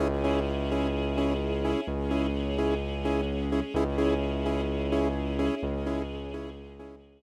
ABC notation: X:1
M:4/4
L:1/8
Q:1/4=128
K:C#m
V:1 name="Lead 2 (sawtooth)"
[CEG] [CEG]2 [CEG]2 [CEG]2 [CEG]- | [CEG] [CEG]2 [CEG]2 [CEG]2 [CEG] | [CEG] [CEG]2 [CEG]2 [CEG]2 [CEG]- | [CEG] [CEG]2 [CEG]2 [CEG]2 z |]
V:2 name="Synth Bass 2" clef=bass
C,,8 | C,,8 | C,,8 | C,,8 |]
V:3 name="String Ensemble 1"
[CEG]8 | [G,CG]8 | [CEG]8 | [G,CG]8 |]